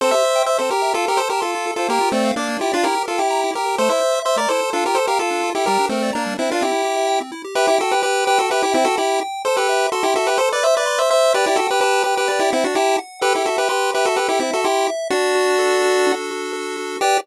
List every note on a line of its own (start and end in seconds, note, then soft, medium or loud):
0.01 0.12 C4 loud
0.01 0.12 A4 medium
0.01 0.11 C5 medium
0.11 0.23 G4 medium
0.11 0.43 C5 medium
0.11 0.43 E5 medium
0.25 0.35 E5 medium
0.36 0.46 G5 medium
0.46 0.58 C5 medium
0.46 0.58 E5 medium
0.46 0.57 E6 medium
0.58 0.70 C4 medium
0.58 0.70 A4 medium
0.58 0.70 C5 medium
0.70 0.93 G4 medium
0.70 0.82 G4 medium
0.70 0.93 A#4 medium
0.82 0.92 E5 medium
0.94 1.04 F4 loud
0.94 1.06 F4 medium
0.94 1.06 A4 medium
1.06 1.19 G4 medium
1.06 1.17 A4 medium
1.06 1.19 A#4 medium
1.17 1.28 A4 medium
1.17 1.28 C5 medium
1.30 1.41 G4 medium
1.30 1.41 A#4 medium
1.30 1.42 A5 medium
1.40 1.71 F4 soft
1.40 1.71 A4 medium
1.40 1.51 C6 medium
1.55 1.65 F4 loud
1.67 1.77 A4 medium
1.76 1.87 F4 medium
1.76 1.87 A4 medium
1.76 1.89 C5 medium
1.88 1.99 A#3 loud
1.88 2.09 G4 medium
1.88 2.09 A#4 medium
2.01 2.11 F4 medium
2.12 2.31 A3 medium
2.12 2.31 C4 medium
2.12 2.24 D5 medium
2.25 2.35 F5 medium
2.36 2.57 A#3 medium
2.36 2.57 D4 medium
2.36 2.47 D6 medium
2.49 2.59 A#3 medium
2.59 2.72 E4 medium
2.59 2.70 F4 medium
2.59 2.72 G4 medium
2.72 2.85 D4 medium
2.72 2.85 F4 medium
2.72 2.83 D5 medium
2.84 2.95 E4 loud
2.84 3.03 G4 medium
2.84 3.03 A#4 medium
2.95 3.06 G4 medium
3.06 3.19 F4 medium
3.06 3.19 A4 medium
3.06 3.16 A#4 medium
3.18 3.51 E4 medium
3.18 3.51 G4 medium
3.18 3.28 G5 medium
3.30 3.41 A#5 medium
3.44 3.55 E4 medium
3.53 3.64 G4 medium
3.53 3.76 G4 medium
3.53 3.76 A#4 medium
3.66 3.76 A#4 medium
3.78 3.89 A3 loud
3.78 3.90 A4 medium
3.78 3.89 C5 medium
3.89 4.00 E4 medium
3.89 4.19 C5 medium
3.89 4.19 E5 medium
4.01 4.12 C5 medium
4.15 4.25 E5 medium
4.25 4.37 C5 medium
4.25 4.37 E5 medium
4.25 4.36 C6 medium
4.36 4.47 A3 medium
4.36 4.49 A#4 medium
4.36 4.49 D5 medium
4.49 4.61 E4 medium
4.49 4.70 A4 medium
4.49 4.70 C5 medium
4.61 4.72 C5 medium
4.73 4.84 D4 loud
4.73 4.84 F4 medium
4.73 4.84 A4 medium
4.85 4.96 F4 medium
4.85 4.97 G4 medium
4.85 4.97 A#4 medium
4.95 5.06 A4 medium
4.95 5.07 A4 medium
4.95 5.06 C5 medium
5.07 5.19 G4 medium
5.07 5.19 A#4 medium
5.07 5.19 F5 medium
5.19 5.50 F4 medium
5.19 5.50 A4 medium
5.19 5.30 A5 medium
5.31 5.41 D4 medium
5.43 5.54 F4 medium
5.55 5.66 E4 medium
5.55 5.65 G4 medium
5.55 5.65 A4 medium
5.66 5.78 G3 loud
5.66 5.86 G4 medium
5.66 5.86 A#4 medium
5.79 5.90 D4 medium
5.89 6.11 A3 medium
5.89 6.11 C4 medium
5.89 6.02 A#4 medium
6.02 6.13 D5 medium
6.13 6.34 A#3 medium
6.13 6.34 D4 medium
6.13 6.24 A#5 medium
6.26 6.37 G3 medium
6.38 6.50 C4 medium
6.38 6.48 D4 medium
6.38 6.50 E4 medium
6.51 6.63 D4 medium
6.51 6.63 F4 medium
6.51 6.61 A#4 medium
6.61 6.72 C4 loud
6.61 7.19 E4 medium
6.61 7.19 G4 medium
6.72 6.82 E4 medium
6.85 6.95 G4 medium
6.97 7.07 E5 medium
7.07 7.18 G5 loud
7.20 7.31 C4 medium
7.32 7.42 E4 medium
7.44 7.55 G4 medium
7.55 7.67 G4 medium
7.55 7.67 B4 medium
7.55 7.76 E5 loud
7.67 7.79 E4 medium
7.67 7.79 G4 medium
7.79 7.92 F#4 medium
7.79 7.92 A4 medium
7.79 8.00 G5 medium
7.91 8.02 G4 medium
7.91 8.02 B4 medium
8.03 8.25 G4 medium
8.03 8.25 B4 medium
8.03 8.24 B5 medium
8.25 8.38 G4 medium
8.25 8.38 B4 medium
8.25 8.47 G5 loud
8.39 8.50 F#4 medium
8.39 8.50 A4 medium
8.50 8.62 G4 medium
8.50 8.62 B4 medium
8.50 8.72 E5 medium
8.63 8.74 E4 medium
8.63 8.74 G4 medium
8.74 8.85 C4 medium
8.74 8.85 E4 medium
8.74 8.95 G5 loud
8.85 8.96 F#4 medium
8.85 8.96 A4 medium
8.97 9.20 E4 medium
8.97 9.20 G4 medium
8.97 9.19 B5 medium
9.21 9.42 G5 medium
9.45 9.56 A4 medium
9.45 9.68 A4 loud
9.45 9.56 C5 medium
9.57 9.87 G4 medium
9.57 9.87 B4 medium
9.69 9.90 E5 medium
9.92 10.03 F#4 medium
9.92 10.03 A4 medium
9.92 10.13 C6 loud
10.03 10.14 E4 medium
10.03 10.14 G4 medium
10.15 10.27 F#4 medium
10.15 10.27 A4 medium
10.15 10.37 E5 loud
10.27 10.38 G4 medium
10.27 10.38 B4 medium
10.38 10.49 A4 medium
10.38 10.60 A4 medium
10.38 10.49 C5 medium
10.52 10.64 B4 medium
10.52 10.64 D5 medium
10.63 10.75 C5 medium
10.63 10.84 E5 loud
10.63 10.75 E5 medium
10.77 10.99 B4 medium
10.77 10.99 D5 medium
10.86 11.07 C6 medium
10.99 11.10 C5 medium
10.99 11.10 E5 medium
11.10 11.33 C5 medium
11.10 11.32 E5 medium
11.10 11.33 E5 medium
11.34 11.45 G4 medium
11.34 11.45 B4 medium
11.34 11.56 D5 loud
11.46 11.57 E4 medium
11.46 11.57 G4 medium
11.56 11.67 F#4 medium
11.56 11.67 A4 medium
11.56 11.80 G5 medium
11.71 11.80 G4 medium
11.71 11.80 B4 medium
11.80 12.03 G4 medium
11.80 12.03 B4 medium
11.80 12.02 A5 medium
12.04 12.15 G4 medium
12.04 12.15 B4 medium
12.04 12.25 G5 medium
12.17 12.28 G4 medium
12.17 12.28 B4 medium
12.28 12.39 G4 medium
12.28 12.40 B4 medium
12.28 12.49 D5 loud
12.39 12.51 E4 medium
12.39 12.51 G4 medium
12.52 12.64 C4 medium
12.52 12.64 E4 medium
12.52 12.73 F#5 medium
12.64 12.75 D4 medium
12.64 12.75 F#4 medium
12.75 12.96 E4 medium
12.75 12.96 G4 medium
12.75 12.98 A5 medium
12.98 13.20 F#5 medium
13.21 13.33 G4 medium
13.21 13.43 A4 loud
13.21 13.33 B4 medium
13.35 13.46 E4 medium
13.35 13.46 G4 medium
13.46 13.57 F#4 medium
13.46 13.57 A4 medium
13.46 13.68 E5 medium
13.58 13.68 G4 medium
13.58 13.68 B4 medium
13.69 13.91 G4 medium
13.69 13.91 B4 medium
13.69 13.90 C6 loud
13.94 14.06 G4 medium
13.94 14.06 B4 medium
13.94 14.15 E5 loud
14.06 14.17 F#4 medium
14.06 14.17 A4 medium
14.16 14.28 G4 medium
14.16 14.38 A4 loud
14.16 14.28 B4 medium
14.29 14.39 E4 medium
14.29 14.40 G4 medium
14.40 14.51 C4 medium
14.40 14.51 E4 medium
14.40 14.61 E5 medium
14.53 14.65 F#4 medium
14.53 14.65 A4 medium
14.64 14.88 E4 medium
14.64 14.88 G4 medium
14.64 14.85 C6 medium
14.87 15.08 E5 loud
15.10 16.12 D4 medium
15.10 16.06 D4 loud
15.10 16.12 F#4 medium
15.35 15.82 F#4 loud
15.59 16.52 A4 loud
15.82 16.30 F#4 medium
16.07 16.96 D4 loud
16.31 16.76 F#4 medium
16.53 16.98 A4 loud
16.77 16.99 F#4 medium
17.01 17.17 G4 loud
17.01 17.18 G4 loud
17.01 17.18 B4 loud
17.01 17.18 D5 loud